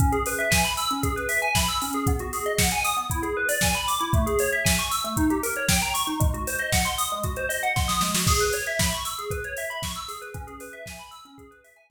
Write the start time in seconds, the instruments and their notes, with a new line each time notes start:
0.00 tubular bells C#4, kick, closed hi-hat
0.12 tubular bells G#4, closed hi-hat
0.26 tubular bells B4, open hi-hat
0.39 tubular bells E5, closed hi-hat
0.51 tubular bells G#5, kick, snare
0.65 tubular bells B5, closed hi-hat
0.77 tubular bells E6, open hi-hat
0.91 tubular bells C#4, closed hi-hat
1.03 tubular bells G#4, kick, closed hi-hat
1.16 tubular bells B4, closed hi-hat
1.29 tubular bells E5, open hi-hat
1.42 tubular bells G#5, closed hi-hat
1.55 tubular bells B5, kick, snare
1.68 tubular bells E6, closed hi-hat
1.82 tubular bells C#4, open hi-hat
1.93 tubular bells G#4, closed hi-hat
2.07 tubular bells B3, kick, closed hi-hat
2.19 tubular bells F#4, closed hi-hat
2.33 tubular bells G#4, open hi-hat
2.46 tubular bells D#5, closed hi-hat
2.59 tubular bells F#5, kick, snare
2.71 tubular bells G#5, closed hi-hat
2.84 tubular bells D#6, open hi-hat
2.97 tubular bells B3, closed hi-hat
3.10 tubular bells E4, kick, closed hi-hat
3.23 tubular bells G#4, closed hi-hat
3.37 tubular bells B4
3.49 tubular bells D5, open hi-hat
3.61 tubular bells G#5, kick, snare
3.75 tubular bells B5, closed hi-hat
3.88 tubular bells D6, open hi-hat
4.01 tubular bells E4, closed hi-hat
4.13 tubular bells A3, kick, closed hi-hat
4.27 tubular bells G#4, closed hi-hat
4.39 tubular bells C#5, open hi-hat
4.52 tubular bells E5, closed hi-hat
4.65 tubular bells G#5, kick, snare
4.79 tubular bells C#6, closed hi-hat
4.91 tubular bells E6, open hi-hat
5.04 tubular bells A3, closed hi-hat
5.17 tubular bells D#4, kick, closed hi-hat
5.30 tubular bells G4, closed hi-hat
5.43 tubular bells A#4, open hi-hat
5.56 tubular bells C#5, closed hi-hat
5.69 tubular bells G5, kick, snare
5.82 tubular bells A#5, closed hi-hat
5.94 tubular bells C#6, open hi-hat
6.07 tubular bells D#4, closed hi-hat
6.20 tubular bells G#3, kick, closed hi-hat
6.34 tubular bells F#4, closed hi-hat
6.47 tubular bells C5, open hi-hat
6.58 tubular bells D#5, closed hi-hat
6.72 tubular bells F#5, kick, snare
6.85 tubular bells C6, closed hi-hat
6.98 tubular bells D#6, open hi-hat
7.10 tubular bells G#3, closed hi-hat
7.23 tubular bells F#4, kick, closed hi-hat
7.36 tubular bells C5, closed hi-hat
7.49 tubular bells D#5, open hi-hat
7.63 tubular bells F#5, closed hi-hat
7.76 tubular bells C6, kick, snare
7.88 tubular bells D#6, snare
8.01 tubular bells G#3, snare
8.14 tubular bells F#4, snare
8.27 tubular bells G#4, kick, crash
8.40 tubular bells B4, closed hi-hat
8.53 tubular bells C#5, open hi-hat
8.66 tubular bells E5, closed hi-hat
8.79 tubular bells B5, kick, snare
8.92 tubular bells C#6, closed hi-hat
9.05 tubular bells E6, open hi-hat
9.19 tubular bells G#4, closed hi-hat
9.30 tubular bells B4, kick, closed hi-hat
9.44 tubular bells C#5, closed hi-hat
9.57 tubular bells E5, open hi-hat
9.70 tubular bells B5, closed hi-hat
9.82 tubular bells C#6, kick, snare
9.95 tubular bells E6, closed hi-hat
10.08 tubular bells G#4, open hi-hat
10.22 tubular bells B4, closed hi-hat
10.34 tubular bells C#4, kick, closed hi-hat
10.47 tubular bells G#4, closed hi-hat
10.60 tubular bells B4, open hi-hat
10.73 tubular bells E5, closed hi-hat
10.86 tubular bells G#5, kick, snare
10.99 tubular bells B5, closed hi-hat
11.11 tubular bells E6, open hi-hat
11.25 tubular bells C#4, closed hi-hat
11.38 tubular bells G#4, kick, closed hi-hat
11.51 tubular bells B4, closed hi-hat
11.64 tubular bells E5, open hi-hat
11.76 tubular bells G#5, closed hi-hat
11.90 tubular bells B5, kick, snare